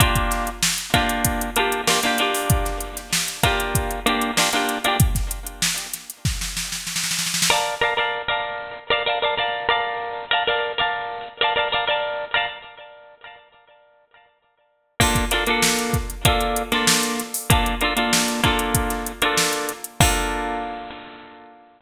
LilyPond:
<<
  \new Staff \with { instrumentName = "Pizzicato Strings" } { \time 4/4 \key bes \mixolydian \tempo 4 = 96 <bes d' f' g'>4. <bes d' f' g'>4 <bes d' f' g'>8 <bes d' f' g'>16 <bes d' f' g'>16 <bes d' f' g'>8~ | <bes d' f' g'>4. <bes d' f' g'>4 <bes d' f' g'>8 <bes d' f' g'>16 <bes d' f' g'>8 <bes d' f' g'>16 | r1 | <bes' d'' f'' a''>8 <bes' d'' f'' a''>16 <bes' d'' f'' a''>8 <bes' d'' f'' a''>4 <bes' d'' f'' a''>16 <bes' d'' f'' a''>16 <bes' d'' f'' a''>16 <bes' d'' f'' a''>8 <bes' d'' f'' a''>8~ |
<bes' d'' f'' a''>8 <bes' d'' f'' a''>16 <bes' d'' f'' a''>8 <bes' d'' f'' a''>4 <bes' d'' f'' a''>16 <bes' d'' f'' a''>16 <bes' d'' f'' a''>16 <bes' d'' f'' a''>8. <bes' d'' f'' a''>16 | r1 | <bes d' f' a'>8 <bes d' f' a'>16 <bes d' f' a'>4~ <bes d' f' a'>16 <bes d' f' a'>8. <bes d' f' a'>4~ <bes d' f' a'>16 | <bes d' f' a'>8 <bes d' f' a'>16 <bes d' f' a'>8. <bes d' f' a'>4~ <bes d' f' a'>16 <bes d' f' a'>4~ <bes d' f' a'>16 |
<bes d' f' a'>1 | }
  \new DrumStaff \with { instrumentName = "Drums" } \drummode { \time 4/4 <hh bd>16 <hh bd>16 <hh sn>16 hh16 sn16 hh16 <hh bd>16 hh16 <hh bd>16 hh16 hh16 hh16 sn16 hh16 hh16 hho16 | <hh bd>16 <hh sn>16 hh16 <hh sn>16 sn16 hh16 <hh bd sn>16 hh16 <hh bd>16 hh16 hh16 hh16 sn16 hh16 hh16 hh16 | <hh bd>16 <hh bd sn>16 hh16 hh16 sn16 <hh sn>16 <hh sn>16 hh16 <bd sn>16 sn16 sn16 sn16 sn32 sn32 sn32 sn32 sn32 sn32 sn32 sn32 | r4 r4 r4 r4 |
r4 r4 r4 r4 | r4 r4 r4 r4 | <cymc bd>16 <hh bd>16 <hh sn>16 hh16 sn16 hh16 <hh bd>16 hh16 <hh bd>16 hh16 hh16 <hh sn>16 sn16 hh16 <hh sn>16 hho16 | <hh bd>16 hh16 hh16 hh16 sn16 hh16 <hh bd>16 hh16 <hh bd>16 <hh sn>16 hh16 hh16 sn16 hh16 hh16 hh16 |
<cymc bd>4 r4 r4 r4 | }
>>